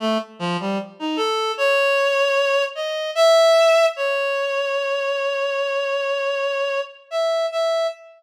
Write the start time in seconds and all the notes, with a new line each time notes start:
0.00 A3
0.39 F3
0.60 G3
0.99 D#4
1.16 A4
1.58 C#5
2.75 D#5
3.15 E5
3.96 C#5
7.11 E5
7.52 E5